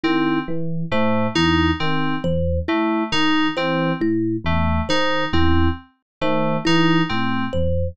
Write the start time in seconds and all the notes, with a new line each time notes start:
0.03 D#3 C4 E4
0.48 E3
0.91 A2 A3 C5
1.35 E2 D#4 E4
1.80 D#3 C4
2.24 E2 C5
2.68 A3 E4
3.12 D#3 D#4
3.56 E3 C4 C5
4.01 A2 E4
4.44 E2 A3
4.89 D#3 D#4 C5
5.33 E2 C4 E4
6.21 D#3 A3 C5
6.65 E3 D#4 E4
7.09 A2 C4
7.53 E2 C5